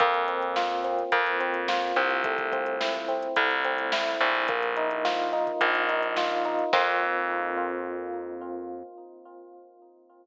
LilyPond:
<<
  \new Staff \with { instrumentName = "Electric Piano 1" } { \time 4/4 \key f \major \tempo 4 = 107 bes8 c'8 f'8 c'8 bes8 c'8 f'8 c'8 | a8 c'8 e'8 c'8 a8 c'8 e'8 c'8 | bes8 ees'8 f'8 ees'8 bes8 ees'8 f'8 ees'8 | <bes c' f'>1 | }
  \new Staff \with { instrumentName = "Electric Bass (finger)" } { \clef bass \time 4/4 \key f \major f,2 f,4. c,8~ | c,2 c,4. bes,,8~ | bes,,2 bes,,2 | f,1 | }
  \new DrumStaff \with { instrumentName = "Drums" } \drummode { \time 4/4 <hh bd>16 hh16 hh16 hh16 sn16 hh16 hh16 hh16 <hh bd>16 hh16 hh16 hh16 sn16 hh16 hh16 hh16 | <hh bd>16 <hh bd>16 <hh bd>16 hh16 sn16 hh16 hh16 hh16 <hh bd>16 hh16 hh16 hh16 sn16 hh16 hh16 hh16 | <hh bd>16 hh16 hh16 hh16 sn16 hh16 hh16 <hh bd>16 <hh bd>16 hh16 hh16 hh16 sn16 hh16 hh16 hh16 | <cymc bd>4 r4 r4 r4 | }
>>